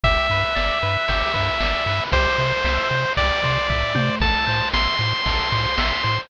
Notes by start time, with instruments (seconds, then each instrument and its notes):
0.03 synth bass 1 G1, lead 1 (square) G4 E5, kick, ride
0.30 synth bass 1 G2, lead 1 (square) B4, ride
0.55 synth bass 1 G1, lead 1 (square) D5, snare
0.82 synth bass 1 G2, lead 1 (square) B4, ride
1.08 synth bass 1 G1, lead 1 (square) G4, kick, ride
1.34 synth bass 1 G2, lead 1 (square) B4, kick, ride
1.60 synth bass 1 G1, lead 1 (square) D5, snare
1.86 synth bass 1 G2, lead 1 (square) B4, ride
2.12 synth bass 1 C2, lead 1 (square) G4 C5, kick, ride
2.38 synth bass 1 C3, lead 1 (square) C5, ride
2.64 synth bass 1 C2, lead 1 (square) E5, snare
2.90 synth bass 1 C3, lead 1 (square) C5, ride
3.17 synth bass 1 C2, lead 1 (square) G4 D5, kick, ride
3.43 synth bass 1 C3, lead 1 (square) C5, kick, ride
3.70 synth bass 1 C2, lead 1 (square) E5, kick, floor tom
3.95 synth bass 1 C3, lead 1 (square) C5, high tom
4.20 synth bass 1 A1, lead 1 (square) A4 A5, kick, crash
4.47 synth bass 1 A2, lead 1 (square) C5, ride
4.73 synth bass 1 A1, lead 1 (square) E5 C6, snare
4.99 synth bass 1 A2, lead 1 (square) C5, ride
5.26 synth bass 1 A1, lead 1 (square) A4, kick, ride
5.52 synth bass 1 A2, lead 1 (square) C5, kick, ride
5.78 synth bass 1 A1, lead 1 (square) E5, snare
6.03 synth bass 1 A2, lead 1 (square) C5, ride